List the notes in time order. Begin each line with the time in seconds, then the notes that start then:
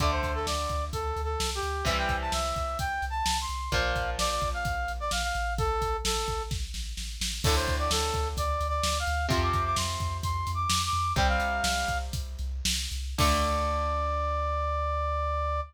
0.00 D2 D3 A3 D5, kick, closed hi-hat
0.12 C5
0.23 D2, kick, closed hi-hat
0.35 A4
0.46 D2 D5, snare
0.69 D2, kick, closed hi-hat
0.93 D2 A4, kick, closed hi-hat
1.16 D2, closed hi-hat
1.24 A4
1.40 C2, snare
1.55 G4
1.62 D2, closed hi-hat
1.85 C2 C3 E3 G3 E5, kick, closed hi-hat
1.98 G5
2.09 C2, kick, closed hi-hat
2.21 A5
2.32 C2 E5, snare
2.56 C2, kick, closed hi-hat
2.79 C2 G5, kick, closed hi-hat
3.02 C2, closed hi-hat
3.10 A5
3.26 C2, snare
3.41 C6
3.49 C2, closed hi-hat
3.72 A#1 A#2 F3 F5, kick, closed hi-hat
3.95 A#1, kick, closed hi-hat
4.18 A#1 D5, snare
4.30 D5
4.42 A#1, kick, closed hi-hat
4.54 F5
4.65 A#1, kick, closed hi-hat
4.88 A#1, closed hi-hat
5.00 D5
5.11 A#1 F5, snare
5.23 F5
5.35 A1, closed hi-hat
5.58 A4, kick, closed hi-hat
5.81 A1, kick, closed hi-hat
6.04 A1 A4, snare
6.28 A1, kick, closed hi-hat
6.51 A1, kick, snare
6.74 A1, snare
6.97 A1, snare
7.20 A1, snare
7.44 D2 A2 D3 A4, kick, crash
7.56 C5
7.68 D2, kick, closed hi-hat
7.79 D5
7.91 D2 A4, snare
8.14 D2, kick, closed hi-hat
8.37 D2 D5, kick, closed hi-hat
8.61 D2, closed hi-hat
8.69 D5
8.83 D2, snare
8.99 F5
9.07 D2, closed hi-hat
9.29 F2 C3 F3 C6, kick, closed hi-hat
9.42 D6
9.53 F2, kick, closed hi-hat
9.65 D6
9.76 F2 C6, snare
10.00 F2, kick, closed hi-hat
10.23 F2 C6, kick, closed hi-hat
10.47 F2, closed hi-hat
10.55 D6
10.70 F2, snare
10.85 D6
10.93 F2, closed hi-hat
11.16 C2 C3 G3 G5, kick, closed hi-hat
11.28 F5
11.40 C2, closed hi-hat
11.63 C2, snare
11.88 C2, kick, closed hi-hat
12.13 C2, kick, closed hi-hat
12.39 C2, closed hi-hat
12.65 C2, snare
12.91 C2, closed hi-hat
13.18 D2 D3 A3 D5, kick, crash